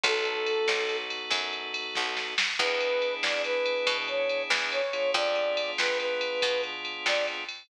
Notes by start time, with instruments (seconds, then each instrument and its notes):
0.04 electric bass (finger) B1, drawbar organ B3 D#4 F#4 A4, brass section A4, kick, ride
0.25 ride
0.46 ride
0.68 electric bass (finger) B1, snare
0.89 ride
1.10 ride
1.30 electric bass (finger) F#2, kick, ride
1.53 ride
1.74 ride
1.95 electric bass (finger) B1, kick, snare
2.17 snare
2.38 snare
2.59 electric bass (finger) E2, drawbar organ B3 D4 E4 G#4, brass section B4, kick, crash
2.80 ride
3.02 ride
3.23 electric bass (finger) E2, brass section D5, snare
3.44 brass section B4, ride
3.66 ride
3.87 electric bass (finger) B2, kick, ride
4.08 brass section C#5, ride
4.29 ride
4.50 electric bass (finger) E2, snare
4.72 brass section C#5, ride
4.93 drawbar organ B3 D4 F4 G#4, ride
5.14 electric bass (finger) F2, brass section D5, kick, ride
5.36 ride
5.57 ride
5.78 electric bass (finger) F2, brass section B4, snare
5.99 brass section B4, ride
6.21 ride
6.42 electric bass (finger) B2, kick, ride
6.63 ride
6.85 ride
7.06 electric bass (finger) F2, brass section D5, snare
7.27 ride
7.49 ride